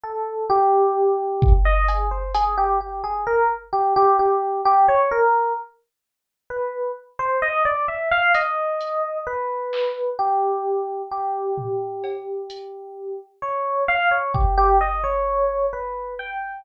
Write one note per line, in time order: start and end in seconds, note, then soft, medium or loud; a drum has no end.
0.03 0.45 A4 medium
0.50 1.53 G4 loud
1.42 kick loud
1.65 1.86 D#5 loud
1.88 2.09 G#4 medium
1.88 closed hi-hat medium
2.11 2.32 C5 medium
2.34 2.55 G#4 loud
2.34 closed hi-hat loud
2.58 2.78 G4 medium
2.81 3.01 G4 medium
3.04 3.24 G#4 medium
3.27 3.48 A#4 medium
3.73 3.93 G4 medium
3.96 4.17 G4 loud
4.19 4.61 G4 medium
4.65 4.86 G4 loud
4.88 5.09 C#5 medium
5.11 5.53 A#4 medium
6.50 6.92 B4 medium
7.19 7.40 C5 loud
7.42 7.63 D#5 loud
7.65 7.86 D5 medium
7.88 8.09 E5 medium
8.11 8.32 F5 loud
8.34 9.18 D#5 medium
8.34 closed hi-hat medium
8.81 closed hi-hat medium
9.27 10.10 B4 medium
9.73 clap medium
10.19 11.02 G4 medium
11.11 13.19 G4 medium
11.58 floor tom medium
12.04 cowbell medium
12.50 closed hi-hat medium
13.42 13.84 C#5 medium
13.88 14.09 F5 loud
14.11 14.32 C#5 medium
14.34 14.55 G4 medium
14.34 kick medium
14.58 14.78 G4 loud
14.81 15.02 D#5 medium
15.04 15.66 C#5 medium
15.73 16.14 B4 medium
16.19 16.61 G5 medium